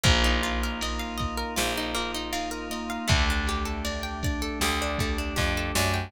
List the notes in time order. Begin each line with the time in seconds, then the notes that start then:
0.03 A#1 A#3 D#4 F4, kick, ride
0.24 D#4
0.43 F4, ride
0.63 A#4
0.81 A#3 D#5, ride
0.99 F5
1.18 D#4 D#5, kick, ride
1.38 A#4
1.56 A#1 A#3 F4, snare
1.78 D#4
1.94 A#3 F4, ride
2.14 D#4
2.33 D#4 F4, ride
2.51 A#4
2.70 A#3 D#5, ride
2.90 F5
3.08 D2 A3 D4 G4, kick, ride
3.30 D4
3.47 G4, ride
3.65 A4
3.85 A3 D5, ride
4.03 G5
4.23 D4 D5, kick, ride
4.42 A4
4.60 D2 A3 G4, snare
4.82 D4
4.98 A3 G4, kick, ride
5.18 D4
5.36 F2 D4 G4, kick, snare
5.57 A4
5.75 F#2 A3 D5, snare
5.94 G5